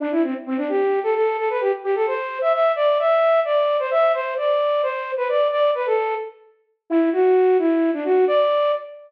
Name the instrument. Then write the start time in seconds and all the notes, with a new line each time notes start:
flute
0.00 D4
0.11 E4
0.23 C4
0.46 C4
0.57 D4
0.69 G4
1.03 A4
1.15 A4
1.38 A4
1.50 B4
1.61 G4
1.84 G4
1.95 A4
2.07 C5
2.41 E5
2.53 E5
2.76 D5
2.99 E5
3.45 D5
3.79 C5
3.91 E5
4.14 C5
4.37 D5
4.83 C5
5.17 B4
5.29 D5
5.52 D5
5.75 B4
5.86 A4
6.90 E4
7.13 F#4
7.59 E4
7.93 D4
8.05 F#4
8.28 D5